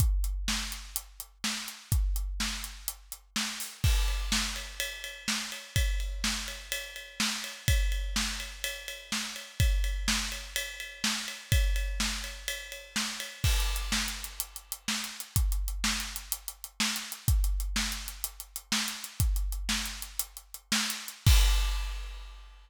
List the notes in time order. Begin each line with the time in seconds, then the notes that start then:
0.00 kick, closed hi-hat
0.24 closed hi-hat
0.48 snare
0.72 closed hi-hat
0.96 closed hi-hat
1.20 closed hi-hat
1.44 snare
1.68 closed hi-hat
1.92 kick, closed hi-hat
2.16 closed hi-hat
2.40 snare
2.64 closed hi-hat
2.88 closed hi-hat
3.12 closed hi-hat
3.36 snare
3.60 open hi-hat
3.84 kick, crash
4.08 ride
4.32 snare
4.56 ride
4.80 ride
5.04 ride
5.28 snare
5.52 ride
5.76 kick, ride
6.00 ride
6.24 snare
6.48 ride
6.72 ride
6.96 ride
7.20 snare
7.44 ride
7.68 kick, ride
7.92 ride
8.16 snare
8.40 ride
8.64 ride
8.88 ride
9.12 snare
9.36 ride
9.60 kick, ride
9.84 ride
10.08 snare
10.32 ride
10.56 ride
10.80 ride
11.04 snare
11.28 ride
11.52 kick, ride
11.76 ride
12.00 snare
12.24 ride
12.48 ride
12.72 ride
12.96 snare
13.20 ride
13.44 kick, crash
13.60 closed hi-hat
13.76 closed hi-hat
13.92 snare
14.08 closed hi-hat
14.24 closed hi-hat
14.40 closed hi-hat
14.56 closed hi-hat
14.72 closed hi-hat
14.88 snare
15.04 closed hi-hat
15.20 closed hi-hat
15.36 kick, closed hi-hat
15.52 closed hi-hat
15.68 closed hi-hat
15.84 snare
16.00 closed hi-hat
16.16 closed hi-hat
16.32 closed hi-hat
16.48 closed hi-hat
16.64 closed hi-hat
16.80 snare
16.96 closed hi-hat
17.12 closed hi-hat
17.28 kick, closed hi-hat
17.44 closed hi-hat
17.60 closed hi-hat
17.76 snare
17.92 closed hi-hat
18.08 closed hi-hat
18.24 closed hi-hat
18.40 closed hi-hat
18.56 closed hi-hat
18.72 snare
18.88 closed hi-hat
19.04 closed hi-hat
19.20 kick, closed hi-hat
19.36 closed hi-hat
19.52 closed hi-hat
19.69 snare
19.86 closed hi-hat
20.02 closed hi-hat
20.19 closed hi-hat
20.37 closed hi-hat
20.54 closed hi-hat
20.72 snare
20.90 closed hi-hat
21.08 closed hi-hat
21.27 kick, crash